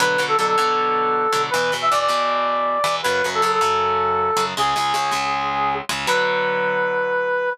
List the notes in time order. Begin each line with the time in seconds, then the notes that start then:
0.00 B2 D3 F#3 B4
0.18 B2 D3 F#3
0.28 A4
0.37 B2 D3 F#3 A4
0.47 A4
0.57 B2 D3 F#3
1.32 B2 D3 F#3
1.50 B2 E3 B4
1.55 E2
1.72 E2 B2 E3
1.82 E5
1.91 E2 B2 E3 D5
2.00 D5
2.08 E2 B2 E3
2.84 E2 B2 E3
3.03 F#2 C#3 F#3 B4
3.24 F#2 C#3 F#3
3.34 A4
3.42 F#2 C#3 F#3 A4
3.52 A4
3.61 F#2 C#3 F#3
4.36 F#2 C#3 F#3
4.57 C#2 C#3 G#3 G#4
4.76 C#2 C#3 G#3
4.94 C#2 C#3 G#3
5.11 C#2 C#3 G#3
5.89 C#2 C#3 G#3
6.07 B2 D3 F#3 B4